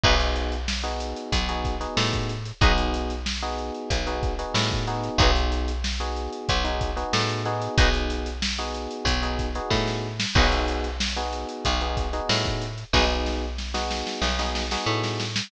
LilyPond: <<
  \new Staff \with { instrumentName = "Acoustic Guitar (steel)" } { \time 4/4 \key b \mixolydian \tempo 4 = 93 <dis' fis' gis' b'>8 r4. b4 a4 | <dis' fis' gis' b'>8 r4. b4 a4 | <dis' fis' gis' b'>8 r4. b4 a4 | <dis' fis' gis' b'>8 r4. b4 a4 |
<dis' fis' gis' b'>8 r4. b4 a4 | <dis' fis' gis' b'>8 r4. b4 a4 | }
  \new Staff \with { instrumentName = "Electric Piano 1" } { \time 4/4 \key b \mixolydian <b dis' fis' gis'>4~ <b dis' fis' gis'>16 <b dis' fis' gis'>4 <b dis' fis' gis'>8 <b dis' fis' gis'>4~ <b dis' fis' gis'>16 | <b dis' fis' gis'>4~ <b dis' fis' gis'>16 <b dis' fis' gis'>4 <b dis' fis' gis'>8 <b dis' fis' gis'>8. <b dis' fis' gis'>8~ | <b dis' fis' gis'>4~ <b dis' fis' gis'>16 <b dis' fis' gis'>4 <b dis' fis' gis'>8 <b dis' fis' gis'>8. <b dis' fis' gis'>8~ | <b dis' fis' gis'>4~ <b dis' fis' gis'>16 <b dis' fis' gis'>4 <b dis' fis' gis'>8 <b dis' fis' gis'>4~ <b dis' fis' gis'>16 |
<b dis' fis' gis'>4~ <b dis' fis' gis'>16 <b dis' fis' gis'>4 <b dis' fis' gis'>8 <b dis' fis' gis'>4~ <b dis' fis' gis'>16 | <b dis' fis' gis'>4~ <b dis' fis' gis'>16 <b dis' fis' gis'>4 <b dis' fis' gis'>8 <b dis' fis' gis'>4~ <b dis' fis' gis'>16 | }
  \new Staff \with { instrumentName = "Electric Bass (finger)" } { \clef bass \time 4/4 \key b \mixolydian b,,2 b,,4 a,4 | b,,2 b,,4 a,4 | b,,2 b,,4 a,4 | b,,2 b,,4 a,4 |
b,,2 b,,4 a,4 | b,,2 b,,4 a,4 | }
  \new DrumStaff \with { instrumentName = "Drums" } \drummode { \time 4/4 <cymc bd>16 hh16 hh16 hh16 sn16 hh16 hh16 hh16 <hh bd>16 hh16 <hh bd>16 <hh sn>16 sn16 <hh bd sn>16 hh16 hh16 | <hh bd>16 <hh sn>16 hh16 <hh sn>16 sn16 hh16 hh16 hh16 <hh bd>16 hh16 <hh bd>16 hh16 sn16 <hh bd>16 hh16 hh16 | <hh bd>16 hh16 hh16 hh16 sn16 hh16 hh16 hh16 <hh bd>16 hh16 <hh bd>16 hh16 sn16 <hh sn>16 hh16 hh16 | <hh bd>16 hh16 hh16 hh16 sn16 hh16 hh16 hh16 <hh bd>16 <hh sn>16 <hh bd>16 hh16 <bd sn>16 sn8 sn16 |
<cymc bd>16 hh16 hh16 <hh sn>16 sn16 hh16 hh16 hh16 <hh bd>16 hh16 <hh bd>16 hh16 sn16 <hh bd>16 hh16 hh16 | <bd sn>8 sn8 sn16 sn16 sn16 sn16 sn16 sn16 sn16 sn16 r16 sn16 sn16 sn16 | }
>>